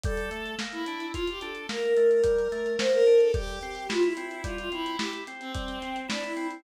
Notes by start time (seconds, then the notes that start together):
0.03 G3 A4, kick, closed hi-hat
0.17 closed hi-hat
0.31 A3, closed hi-hat
0.46 closed hi-hat
0.59 A#3, snare
0.72 E4, closed hi-hat
0.86 D4, closed hi-hat
1.00 closed hi-hat
1.13 F4, kick, closed hi-hat
1.27 G4, closed hi-hat
1.41 D4 A4, closed hi-hat
1.55 closed hi-hat
1.69 A#3 A#4, snare
1.83 A#4, closed hi-hat
1.97 A3, closed hi-hat
2.10 A#4, closed hi-hat
2.23 G3, kick, closed hi-hat
2.39 closed hi-hat
2.52 A3, closed hi-hat
2.66 closed hi-hat
2.78 A#3 C5, snare
2.93 A#4, closed hi-hat
3.06 D4, closed hi-hat
3.20 A4, closed hi-hat
3.34 G3 G4, kick, closed hi-hat
3.48 closed hi-hat
3.61 C4, closed hi-hat
3.75 closed hi-hat
3.89 E4 F4, snare
4.03 E4, closed hi-hat
4.17 C4, closed hi-hat
4.31 closed hi-hat
4.43 G3 F4, kick, closed hi-hat
4.58 F4, closed hi-hat
4.72 C4 E4, closed hi-hat
4.86 closed hi-hat
4.98 E4 G4, snare
5.13 closed hi-hat
5.27 C4, closed hi-hat
5.40 C4, closed hi-hat
5.54 G3, kick, closed hi-hat
5.68 closed hi-hat
5.82 C4, closed hi-hat
5.96 closed hi-hat
6.08 D4 E4, snare
6.23 E4, closed hi-hat
6.37 C4, closed hi-hat
6.51 closed hi-hat